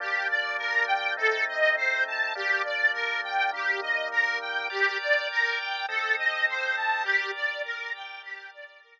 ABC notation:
X:1
M:4/4
L:1/8
Q:1/4=102
K:Gm
V:1 name="Accordion"
G d B g A e c a | G d B g G e B g | G d B g A e c a | G d B g G d B z |]
V:2 name="Drawbar Organ"
[G,B,D]4 [A,CE]4 | [G,B,D]4 [E,G,B,]4 | [Bdg]4 [CAe]4 | [GBd]4 [GBd]4 |]